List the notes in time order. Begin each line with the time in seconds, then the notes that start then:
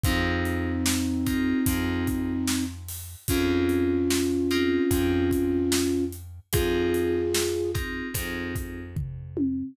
0.04 F2 C4 D#4 F4 G#4, kick, closed hi-hat
0.45 closed hi-hat
0.86 snare
1.26 C4 D#4 F4 G#4, kick, closed hi-hat
1.66 F2 C4 D#4 F4 G#4, kick, closed hi-hat
2.07 kick, closed hi-hat
2.47 snare
2.89 open hi-hat
3.28 F2 C4 C#4 D#4 F4 G#4, kick, closed hi-hat
3.69 closed hi-hat
4.10 snare
4.51 C4 D#4 F4 G#4, closed hi-hat
4.91 F2 C4 D#4 F4 G#4, kick, closed hi-hat
5.31 kick, closed hi-hat
5.72 snare
6.13 closed hi-hat
6.53 F2 C4 D#4 F4 G#4, kick, closed hi-hat
6.94 closed hi-hat
7.34 snare
7.74 C4 D#4 F4 G#4, kick, closed hi-hat
8.14 F2 C4 D#4 F4 G#4, kick, closed hi-hat
8.56 kick, closed hi-hat
8.96 kick, floor tom
9.37 high tom